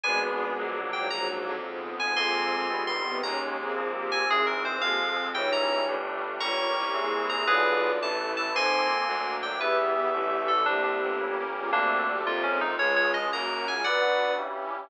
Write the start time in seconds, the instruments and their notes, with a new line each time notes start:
0.03 violin G#1 B2 G#3, electric piano 2 G#3 B3 D4 G#5, pad 5 (bowed) G#3 B3 D4
0.57 violin A#1, pad 5 (bowed) F#3 A#3 D4, electric piano 2 F#3 A#3 D4
0.93 violin G#2 F#3, electric piano 2 G5
1.10 violin A#1 G#2 F#3, pad 5 (bowed) F#3 A#3 D4, electric piano 2 A#5
1.46 violin F2
1.63 violin G#2 F3, pad 5 (bowed) F3 G#3 B3
1.99 violin G#2 F3, electric piano 2 G#5
2.16 violin F2 G#3 F4, electric piano 2 F3 A#3 C4 G#5 C6, pad 5 (bowed) F3 A#3 C4
2.70 violin G1, electric piano 2 D#3 G3 B3, pad 5 (bowed) D#3 G3 B3
2.87 electric piano 2 C6
3.05 violin C3 B3
3.23 violin D#2 C#4 A#4, electric piano 2 D#3 G#3 A#3 A#5, pad 5 (bowed) D#3 G#3 A#3
3.59 violin C4 G#4
3.76 violin A#1, electric piano 2 F3 A#3 C4, pad 5 (bowed) F3 A#3 C4
3.94 violin A#3 G4
4.12 electric piano 2 G#5
4.29 violin G#1 C4 G#4, pad 5 (bowed) E3 G#3 C4, electric piano 2 E3 G#3 C4 G#4
4.46 electric piano 2 A#4
4.65 electric piano 2 C5
4.81 violin F2 A#3 G4, pad 5 (bowed) F3 G#3 C4, electric piano 2 F3 G#3 C4 F5
5.35 violin C#2 D#4 C#5, electric piano 2 E3 G3 C#4 G5, pad 5 (bowed) E3 G3 C#4
5.52 electric piano 2 A#5
5.88 violin G1, electric piano 2 G3 A3 D4, pad 5 (bowed) G3 A3 D4
6.40 violin G1 F4 C#5, electric piano 2 G3 A#3 C#4 A#5 C#6, pad 5 (bowed) G4 A#4 C#5
6.77 violin C2
6.94 electric piano 2 E3 G#3 C4, violin A#3 G#4, pad 5 (bowed) E4 G#4 C5
7.29 electric piano 2 A#5
7.47 violin B1 F4 D5, electric piano 2 D3 F3 B3 G#4 B4, pad 5 (bowed) D4 F4 B4
8.01 violin A1, electric piano 2 E3 A3 B3 A5, pad 5 (bowed) E4 A4 B4
8.37 electric piano 2 A5
8.54 violin F2 D#4 C5, electric piano 2 F3 A#3 C4 G#5 C6, pad 5 (bowed) F3 A#3 C4
9.06 violin D2, pad 5 (bowed) F#3 A#3 D4, electric piano 2 F#3 A#3 D4
9.43 electric piano 2 G5
9.59 violin E2 G4 E5, electric piano 2 E3 G3 B3 B4, pad 5 (bowed) E3 G3 B3
10.13 violin A1, pad 5 (bowed) D3 E3 A3, electric piano 2 D3 E3 A3
10.48 electric piano 2 A4
10.66 violin C2 A#3 G4, electric piano 2 C3 D3 G3 D4, pad 5 (bowed) C4 D4 G4
10.84 electric piano 2 D4
11.02 violin G1
11.20 electric piano 2 C#3 G3 A#3, pad 5 (bowed) C#4 G4 A#4
11.56 violin G#3 F4
11.72 violin D2 C3 A3, electric piano 2 D3 G3 A3 A#3 D4, pad 5 (bowed) D4 G4 A4
12.08 violin A#2 G3
12.25 violin F2, electric piano 2 C3 F3 A#3 F4, pad 5 (bowed) C4 F4 A#4
12.43 violin G#2 F3, electric piano 2 C#4
12.61 electric piano 2 D#4
12.78 violin C#2 G#3 F4, electric piano 2 C#3 F3 G#3 C#5, pad 5 (bowed) C#4 F4 G#4
12.96 electric piano 2 C#5
13.14 electric piano 2 D#5
13.31 violin F#2 A#3 F#4, electric piano 2 C#3 F#3 A#3 A#5, pad 5 (bowed) C#4 F#4 A#4
13.68 violin G#3 F4, electric piano 2 G#5
13.84 electric piano 2 D3 F#3 B3 D5 F#5, pad 5 (bowed) D4 F#4 B4, violin D4 B4
14.38 electric piano 2 C#3 E3 G3, pad 5 (bowed) C#4 E4 G4